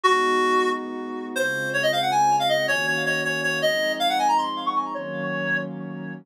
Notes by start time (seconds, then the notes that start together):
0.03 G#3 B3 D#4 F#4
1.36 C#3 G#3 C4 F4 C5
1.74 C#5
1.83 D#5
1.92 F5
2.02 F#5
2.11 G#5
2.40 F5
2.49 D#5
2.68 D#3 A#3 C#4 F#4 C#5
2.87 C#5
3.06 C#5
3.24 C#5
3.43 C#5
3.62 F3 G#3 C4 D#4 D#5
4.00 F5
4.09 F#5
4.19 G#5
4.28 A#5
4.38 C6
4.66 C#6
4.75 C#6
4.94 D#3 F#3 A#3 C#4 C#5